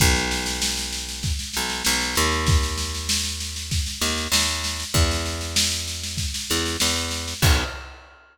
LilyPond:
<<
  \new Staff \with { instrumentName = "Electric Bass (finger)" } { \clef bass \time 4/4 \key b \major \tempo 4 = 97 b,,2~ b,,8 b,,8 b,,8 dis,8~ | dis,2~ dis,8 dis,8 dis,4 | e,2~ e,8 e,8 e,4 | b,,4 r2. | }
  \new DrumStaff \with { instrumentName = "Drums" } \drummode { \time 4/4 <bd sn>16 sn16 sn16 sn16 sn16 sn16 sn16 sn16 <bd sn>16 sn16 sn16 sn16 sn16 sn16 sn16 sn16 | <bd sn>16 sn16 sn16 sn16 sn16 sn16 sn16 sn16 <bd sn>16 sn16 sn16 sn16 sn16 sn16 sn16 sn16 | <bd sn>16 sn16 sn16 sn16 sn16 sn16 sn16 sn16 <bd sn>16 sn16 sn16 sn16 sn16 sn16 sn16 sn16 | <cymc bd>4 r4 r4 r4 | }
>>